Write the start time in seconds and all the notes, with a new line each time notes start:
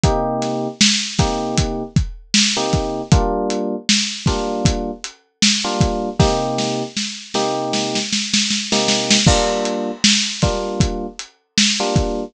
0.04 C3 A#3 D#4 G4, kick, closed hi-hat
0.42 snare, closed hi-hat
0.81 snare
1.18 C3 A#3 D#4 G4, kick, snare, closed hi-hat
1.58 kick, closed hi-hat
1.96 kick, closed hi-hat
2.34 snare
2.57 C3 A#3 D#4 G4
2.73 kick, closed hi-hat
3.12 G3 A#3 D4 F4, kick, closed hi-hat
3.50 closed hi-hat
3.89 snare
4.26 G3 A#3 D4 F4, kick, snare, closed hi-hat
4.65 kick, closed hi-hat
5.04 closed hi-hat
5.42 snare
5.64 G3 A#3 D4 F4
5.81 kick, closed hi-hat
6.19 C3 A#3 D#4 G4, kick, snare
6.58 snare
6.97 snare
7.34 C3 A#3 D#4 G4, snare
7.73 snare
7.95 snare
8.13 snare
8.34 snare
8.50 snare
8.72 C3 A#3 D#4 G4, snare
8.88 snare
9.11 snare
9.27 G3 A#3 D4 F4, kick, crash
9.65 closed hi-hat
10.04 snare
10.42 G3 A#3 D4 F4, kick, snare, closed hi-hat
10.80 kick, closed hi-hat
11.19 closed hi-hat
11.58 snare
11.80 G3 A#3 D4 F4
11.96 kick, closed hi-hat